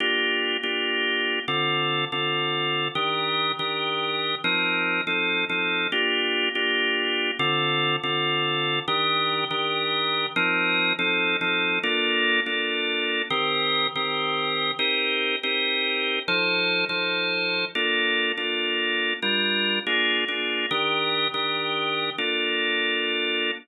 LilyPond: \new Staff { \time 7/8 \key bes \major \tempo 4 = 142 <bes d' f' g'>4. <bes d' f' g'>2 | <d c' f' a'>4. <d c' f' a'>2 | <ees d' g' bes'>4. <ees d' g' bes'>2 | <f c' ees' bes'>4. <f c' ees' a'>4 <f c' ees' a'>4 |
<bes d' f' g'>4. <bes d' f' g'>2 | <d c' f' a'>4. <d c' f' a'>2 | <ees d' g' bes'>4. <ees d' g' bes'>2 | <f c' ees' bes'>4. <f c' ees' a'>4 <f c' ees' a'>4 |
<bes d' f' a'>4. <bes d' f' a'>2 | <ees c' g' bes'>4. <ees c' g' bes'>2 | <c' ees' g' bes'>4. <c' ees' g' bes'>2 | <f ees' a' c''>4. <f ees' a' c''>2 |
<bes d' f' a'>4. <bes d' f' a'>2 | <g d' f' bes'>4. <bes d' f' aes'>4 <bes d' f' aes'>4 | <ees d' g' bes'>4. <ees d' g' bes'>2 | <bes d' f' a'>2.~ <bes d' f' a'>8 | }